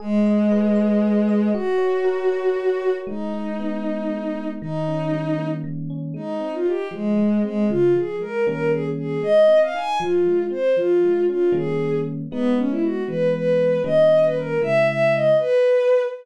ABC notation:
X:1
M:6/8
L:1/16
Q:3/8=78
K:G#m
V:1 name="Violin"
G,12 | F12 | D12 | D8 z4 |
[K:Ab] E3 F G2 A,4 A,2 | F2 A2 B2 B2 A z A2 | e3 f a2 F4 c2 | F4 F2 A4 z2 |
[K:G#m] B,2 C E F2 B2 B4 | d3 B A2 e2 e2 d2 | B6 z6 |]
V:2 name="Electric Piano 1"
G2 d2 B2 d2 G2 d2 | F2 c2 A2 c2 F2 c2 | G,2 D2 B,2 D2 G,2 D2 | D,2 C2 =G,2 A,2 D,2 C2 |
[K:Ab] A,2 C2 E2 F,2 A,2 C2 | D,2 F,2 A,2 [E,G,B,D]6 | A,2 C2 E2 F,2 A,2 C2 | F,2 A,2 D2 [E,G,B,D]6 |
[K:G#m] [G,B,D]6 [E,G,B,]6 | [D,=G,A,C]6 [C,^G,E]6 | z12 |]